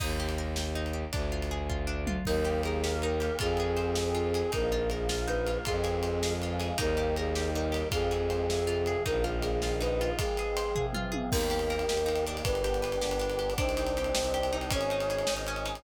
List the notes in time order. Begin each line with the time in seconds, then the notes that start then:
0.00 D#2 D#4, kick, crash
0.20 G4
0.29 ride
0.38 A#4
0.56 G4, snare
0.75 D#4
0.86 ride
0.93 G4
1.12 D2 D4, kick, ride
1.32 F4
1.42 ride
1.51 G#4
1.69 F4, kick
1.87 D4
2.07 F4, mid tom
2.25 D#2 A#3 D#4 G4 A#4, kick, crash
2.45 G4, ride
2.63 G#4 A#4, ride
2.83 A#3 G4 A#4, snare
3.02 D#4 A#4, ride
3.20 G4, ride
3.39 F2 C4 F4 G#4, kick, ride
3.57 G#4, ride
3.76 C5, ride
3.95 C4 G#4 C5, snare
4.15 F4, ride
4.34 G#4, ride
4.52 A#1 A#3 D#4 F4 A#4, kick, ride
4.72 F4, ride
4.90 G#4 A#4, ride
5.09 A#3 F4 A#4, snare
5.27 D#4 B4, ride
5.47 F4, ride
5.65 F2 G#3 C4 F4 G#4, kick, ride
5.84 G#4, ride
6.03 C5, ride
6.23 F3 G#3 F4 G#4, snare
6.42 F4, ride
6.60 G#4, ride
6.78 D#2 G3 A#3 D#4 A#4, kick, ride
6.97 G4, ride
7.16 G#4 A#4, ride
7.35 D#3 G3 D#4 G4, snare
7.54 D#4 A#4, ride
7.72 G4, ride
7.91 F2 F3 G#3 C4 F4 G#4, kick, ride
8.11 G#4, ride
8.30 C5, ride
8.49 C3 F3 C4 G#4, snare
8.67 F4, ride
8.86 G#4, ride
9.06 A#1 D#3 F3 A#3 D#4 A#4, kick, ride
9.24 F4, ride
9.42 G#4 A#4, ride
9.62 D#3 A#3 D#4 F4, snare
9.81 D#4 B4, ride
10.01 F4, ride
10.18 F3 G#3 C4 F4 G#4, kick, ride
10.37 G#4, ride
10.57 C5, ride
10.75 C3 F3 C4 G#4, kick, floor tom
10.93 F4, mid tom
11.12 G#4, high tom
11.30 D#2 A#3 D#4 G4 A#4, kick, crash
11.41 ride
11.50 G4, ride
11.59 ride
11.70 A#4, ride
11.79 ride
11.88 D#2 G4, snare
11.97 ride
12.06 D#4, ride
12.16 ride
12.27 D4, ride
12.37 ride
12.44 G1 B3 D4 G4 B4, kick, ride
12.55 ride
12.64 G4, ride
12.74 ride
12.82 B4, ride
12.92 ride
13.01 G1 G4, snare
13.11 ride
13.19 D4, ride
13.30 ride
13.39 G4, ride
13.50 ride
13.58 C2 C4 D4 D#4 G4 C5, kick, ride
13.69 ride
13.77 D#4, ride
13.87 ride
13.97 G4, ride
14.04 ride
14.15 C2 C5, snare
14.24 ride
14.34 G4, ride
14.43 ride
14.53 D#4, ride
14.61 ride
14.71 G#1 C#4 D#4 G#4 C#5, kick, ride
14.81 ride
14.90 D#4, ride
15.00 ride
15.10 G#4, ride
15.18 ride
15.27 G#1 D#4, snare
15.37 ride
15.47 C#4, ride
15.56 ride
15.65 D#4, ride
15.75 ride